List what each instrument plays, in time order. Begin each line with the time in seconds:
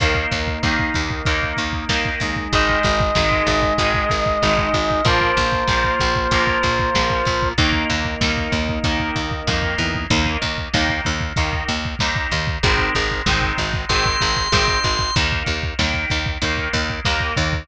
0.00 electric bass (finger) D#2, overdriven guitar D#3 A#3, drawbar organ A#3 D#4, kick, closed hi-hat
0.15 kick
0.31 electric bass (finger) D#2, kick, snare, closed hi-hat
0.48 kick
0.63 electric bass (finger) D#2, overdriven guitar D#3 A#3, kick, snare
0.79 kick
0.94 electric bass (finger) D#2, kick, closed hi-hat
1.10 kick
1.25 electric bass (finger) D#2, overdriven guitar D#3 A#3, kick, closed hi-hat
1.43 kick
1.57 electric bass (finger) D#2, kick, closed hi-hat
1.73 kick
1.89 electric bass (finger) D#2, overdriven guitar D#3 A#3, kick, snare
2.05 kick
2.20 electric bass (finger) D#2, drawbar organ G#3 D#4, kick, closed hi-hat
2.36 kick
2.53 electric bass (finger) G#1, overdriven guitar D#3 G#3, brass section D#5, kick, closed hi-hat
2.69 kick
2.83 electric bass (finger) G#1, kick, snare, closed hi-hat
3.00 kick
3.15 electric bass (finger) G#1, overdriven guitar D#3 G#3, kick, snare
3.31 kick
3.47 electric bass (finger) G#1, kick, closed hi-hat
3.62 kick
3.78 electric bass (finger) G#1, overdriven guitar D#3 G#3, kick, closed hi-hat
3.94 kick
4.10 electric bass (finger) G#1, kick, closed hi-hat
4.26 kick
4.42 electric bass (finger) G#1, overdriven guitar D#3 G#3, kick, snare
4.58 kick
4.74 electric bass (finger) G#1, kick, closed hi-hat
4.91 kick
5.05 electric bass (finger) A#1, overdriven guitar F3 A#3, drawbar organ A#3 F4, brass section C5, kick, closed hi-hat
5.21 kick
5.37 electric bass (finger) A#1, kick, snare, closed hi-hat
5.53 kick
5.68 electric bass (finger) A#1, overdriven guitar F3 A#3, kick, snare
5.84 kick
6.00 electric bass (finger) A#1, kick, closed hi-hat
6.16 kick
6.31 electric bass (finger) A#1, overdriven guitar F3 A#3, kick, closed hi-hat
6.47 kick
6.63 electric bass (finger) A#1, kick, closed hi-hat
6.79 kick
6.95 electric bass (finger) A#1, overdriven guitar F3 A#3, kick, snare
7.10 kick
7.25 electric bass (finger) A#1, kick, closed hi-hat
7.43 kick
7.58 electric bass (finger) D#2, overdriven guitar D#3 A#3, drawbar organ A#3 D#4, kick, closed hi-hat
7.73 kick
7.90 electric bass (finger) D#2, kick, snare, closed hi-hat
8.05 kick
8.21 electric bass (finger) D#2, overdriven guitar D#3 A#3, kick, snare
8.37 kick
8.52 electric bass (finger) D#2, kick, closed hi-hat
8.69 kick
8.84 electric bass (finger) D#2, overdriven guitar D#3 A#3, kick, closed hi-hat
8.99 kick
9.16 electric bass (finger) D#2, kick, closed hi-hat
9.31 kick
9.47 electric bass (finger) F2, overdriven guitar D#3 A#3, kick, snare
9.62 kick
9.78 electric bass (finger) E2, kick, closed hi-hat
9.95 kick
10.10 electric bass (finger) D#2, overdriven guitar D#3 A#3, kick, closed hi-hat
10.26 kick
10.42 electric bass (finger) D#2, kick, closed hi-hat
10.58 kick
10.74 electric bass (finger) D#2, overdriven guitar D#3 A#3, kick, snare
10.89 kick
11.05 electric bass (finger) D#2, kick, closed hi-hat
11.21 kick
11.36 electric bass (finger) D#2, overdriven guitar D#3 A#3, kick, closed hi-hat
11.53 kick
11.68 electric bass (finger) D#2, kick, closed hi-hat
11.85 kick
11.99 electric bass (finger) D#2, overdriven guitar D#3 A#3, kick, snare
12.16 kick
12.31 electric bass (finger) D#2, kick, closed hi-hat
12.47 kick
12.63 electric bass (finger) G#1, overdriven guitar D#3 G#3 C4, kick, closed hi-hat
12.78 kick
12.95 electric bass (finger) G#1, kick, closed hi-hat
13.11 kick
13.26 electric bass (finger) G#1, overdriven guitar D#3 G#3 C4, kick, snare
13.42 kick
13.58 electric bass (finger) G#1, kick, closed hi-hat
13.74 kick
13.89 electric bass (finger) G#1, overdriven guitar D#3 G#3 C4, drawbar organ C6, kick, closed hi-hat
14.06 kick
14.21 electric bass (finger) G#1, kick, closed hi-hat
14.37 kick
14.52 electric bass (finger) G#1, overdriven guitar D#3 G#3 C4, kick, snare
14.68 kick
14.84 electric bass (finger) G#1, kick, closed hi-hat
14.99 kick
15.16 electric bass (finger) D#2, overdriven guitar D#3 A#3, kick, closed hi-hat
15.32 kick
15.46 electric bass (finger) D#2, kick, closed hi-hat
15.63 kick
15.79 electric bass (finger) D#2, overdriven guitar D#3 A#3, kick, snare
15.94 kick
16.10 electric bass (finger) D#2, kick, closed hi-hat
16.26 kick
16.42 electric bass (finger) D#2, overdriven guitar D#3 A#3, kick, closed hi-hat
16.58 kick
16.73 electric bass (finger) D#2, kick, closed hi-hat
16.90 kick
17.05 electric bass (finger) D#2, overdriven guitar D#3 A#3, kick, snare
17.20 kick
17.36 electric bass (finger) D#2, kick, closed hi-hat
17.53 kick